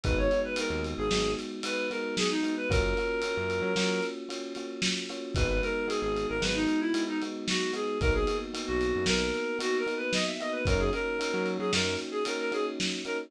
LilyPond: <<
  \new Staff \with { instrumentName = "Clarinet" } { \time 5/4 \key gis \minor \tempo 4 = 113 b'16 cis''8 b'16 ais'8 r16 gis'8. r8 b'8 ais'8 gis'16 dis'8 b'16 | ais'2. r2 | b'16 b'16 ais'8 gis'16 gis'8 ais'16 b'16 dis'8 e'8 dis'16 r8 fis'8 gis'8 | ais'16 gis'8 r8 fis'8. ais'4 \tuplet 3/2 { fis'8 ais'8 b'8 } dis''16 e''16 dis''16 b'16 |
ais'16 gis'16 ais'4~ ais'16 gis'16 ais'8 r16 gis'16 ais'16 ais'16 gis'16 r8. ais'16 r16 | }
  \new Staff \with { instrumentName = "Electric Piano 1" } { \time 5/4 \key gis \minor <gis b dis' fis'>8 <gis b dis' fis'>8 <gis b dis' fis'>4 <gis b dis' fis'>4 <gis b dis' fis'>8 <gis b dis' fis'>4 <gis b dis' fis'>8 | <ais cis' eis' fis'>8 <ais cis' eis' fis'>8 <ais cis' eis' fis'>4 <ais cis' eis' fis'>4 <ais cis' eis' fis'>8 <ais cis' eis' fis'>4 <ais cis' eis' fis'>8 | <gis b dis' fis'>8 <gis b dis' fis'>8 <gis b dis' fis'>4 <gis b dis' fis'>4 <gis b dis' fis'>8 <gis b dis' fis'>4 <gis b dis' fis'>8 | <ais b dis' fis'>8 <ais b dis' fis'>8 <ais b dis' fis'>4 <ais b dis' fis'>4 <ais b dis' fis'>8 <ais b dis' fis'>4 <ais b dis' fis'>8 |
<ais cis' dis' fis'>8 <ais cis' dis' fis'>8 <ais cis' dis' fis'>4 <ais cis' dis' fis'>4 <ais cis' dis' fis'>8 <ais cis' dis' fis'>4 <ais cis' dis' fis'>8 | }
  \new Staff \with { instrumentName = "Synth Bass 1" } { \clef bass \time 5/4 \key gis \minor gis,,4~ gis,,16 dis,8 gis,,16 gis,,2. | fis,4~ fis,16 fis,8 fis16 fis2. | gis,,4~ gis,,16 gis,,8 gis,,16 gis,,2. | b,,4~ b,,16 b,,8 fis,16 b,,2. |
fis,4~ fis,16 fis8 fis16 fis,2. | }
  \new DrumStaff \with { instrumentName = "Drums" } \drummode { \time 5/4 <bd cymr>8 cymr8 cymr8 cymr8 sn8 cymr8 cymr8 cymr8 sn8 cymr8 | <bd cymr>8 cymr8 cymr8 cymr8 sn8 cymr8 cymr8 cymr8 sn8 cymr8 | <bd cymr>8 cymr8 cymr8 cymr8 sn8 cymr8 cymr8 cymr8 sn8 cymr8 | <bd cymr>8 cymr8 cymr8 cymr8 sn8 cymr8 cymr8 cymr8 sn8 cymr8 |
<bd cymr>8 cymr8 cymr8 cymr8 sn8 cymr8 cymr8 cymr8 sn8 cymr8 | }
>>